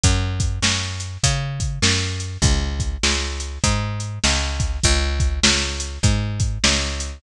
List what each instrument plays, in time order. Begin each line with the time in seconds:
0.04 electric bass (finger) F#2, kick, closed hi-hat
0.40 kick, closed hi-hat
0.62 electric bass (finger) F#2, snare
1.00 closed hi-hat
1.24 electric bass (finger) C#3, kick, closed hi-hat
1.60 kick, closed hi-hat
1.82 electric bass (finger) F#2, snare
2.20 closed hi-hat
2.42 electric bass (finger) C#2, kick, closed hi-hat
2.80 kick, closed hi-hat
3.03 electric bass (finger) C#2, snare
3.40 closed hi-hat
3.64 electric bass (finger) G#2, kick, closed hi-hat
4.00 closed hi-hat
4.24 electric bass (finger) C#2, snare
4.60 kick, closed hi-hat
4.83 electric bass (finger) C#2, kick, closed hi-hat
5.20 kick, closed hi-hat
5.43 electric bass (finger) C#2, snare
5.80 closed hi-hat
6.03 electric bass (finger) G#2, kick, closed hi-hat
6.40 kick, closed hi-hat
6.64 electric bass (finger) C#2, snare
7.00 closed hi-hat